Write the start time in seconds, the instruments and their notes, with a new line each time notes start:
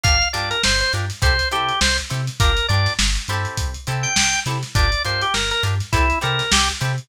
0.03 synth bass 1 G1, acoustic guitar (steel) D4 F4 G4 A#4, drawbar organ F5, kick, closed hi-hat
0.22 closed hi-hat
0.33 synth bass 1 G2, acoustic guitar (steel) D4 F4 G4 A#4, drawbar organ D5, snare, closed hi-hat
0.51 drawbar organ A#4, closed hi-hat
0.63 synth bass 1 G1, drawbar organ C5, snare
0.80 drawbar organ C5, closed hi-hat
0.93 synth bass 1 G2, acoustic guitar (steel) D4 F4 G4 A#4, closed hi-hat
1.10 snare, closed hi-hat
1.22 synth bass 1 C2, acoustic guitar (steel) C4 E4 G4 A4, drawbar organ C5, kick, closed hi-hat
1.39 closed hi-hat
1.51 synth bass 1 C3, acoustic guitar (steel) C4 E4 G4 A4, drawbar organ G4, closed hi-hat
1.69 closed hi-hat
1.81 synth bass 1 C2, drawbar organ C5, snare
1.98 closed hi-hat
2.10 synth bass 1 C3, acoustic guitar (steel) C4 E4 G4 A4, closed hi-hat
2.27 snare, closed hi-hat
2.40 synth bass 1 G1, acoustic guitar (steel) D4 F4 G4 A#4, drawbar organ A#4, kick, closed hi-hat
2.57 closed hi-hat
2.68 synth bass 1 G2, acoustic guitar (steel) D4 F4 G4 A#4, drawbar organ D5, closed hi-hat
2.86 snare, closed hi-hat
2.99 synth bass 1 G1, snare
3.16 closed hi-hat
3.28 synth bass 1 G2, acoustic guitar (steel) C4 E4 G4 A4, closed hi-hat
3.45 closed hi-hat
3.57 synth bass 1 C2, kick, closed hi-hat
3.74 closed hi-hat
3.87 synth bass 1 C3, acoustic guitar (steel) C4 E4 G4 A4, closed hi-hat
4.03 drawbar organ G5, closed hi-hat
4.15 synth bass 1 C2, drawbar organ G5, snare
4.33 closed hi-hat
4.46 synth bass 1 C3, acoustic guitar (steel) C4 E4 G4 A4, snare, closed hi-hat
4.63 snare, closed hi-hat
4.75 synth bass 1 G1, acoustic guitar (steel) D4 F4 G4 A#4, drawbar organ D5, kick, closed hi-hat
4.92 closed hi-hat
5.05 synth bass 1 G2, acoustic guitar (steel) D4 F4 G4 A#4, drawbar organ C5, closed hi-hat
5.21 drawbar organ G4, closed hi-hat
5.34 synth bass 1 G1, drawbar organ A#4, snare
5.51 drawbar organ A#4, closed hi-hat
5.63 synth bass 1 G2, acoustic guitar (steel) D4 F4 G4 A#4, closed hi-hat
5.80 snare, closed hi-hat
5.92 synth bass 1 C2, acoustic guitar (steel) C4 E4 G4 A4, drawbar organ E4, kick, closed hi-hat
6.10 closed hi-hat
6.21 synth bass 1 C3, acoustic guitar (steel) C4 E4 G4 A4, drawbar organ A#4, closed hi-hat
6.39 snare, closed hi-hat
6.52 synth bass 1 C2, drawbar organ G4, snare
6.69 closed hi-hat
6.81 synth bass 1 C3, acoustic guitar (steel) C4 E4 G4 A4, closed hi-hat
6.98 closed hi-hat